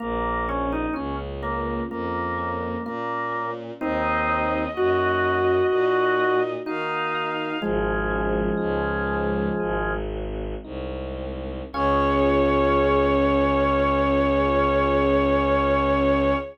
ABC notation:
X:1
M:4/4
L:1/16
Q:1/4=63
K:Db
V:1 name="Violin"
z16 | e12 f4 | "^rit." z16 | d16 |]
V:2 name="Drawbar Organ"
B,2 D E D z B,2 B,4 B,3 z | [CE]4 G8 E4 | "^rit." [F,A,]10 z6 | D16 |]
V:3 name="Electric Piano 1"
B,2 D2 F2 D2 B,2 D2 F2 D2 | B,2 E2 G2 E2 B,2 E2 G2 E2 | "^rit." A,2 D2 E2 D2 A,2 C2 E2 C2 | [DFA]16 |]
V:4 name="Violin" clef=bass
B,,,4 D,,4 F,,4 B,,4 | E,,4 G,,4 B,,4 E,4 | "^rit." A,,,4 D,,4 A,,,4 C,,4 | D,,16 |]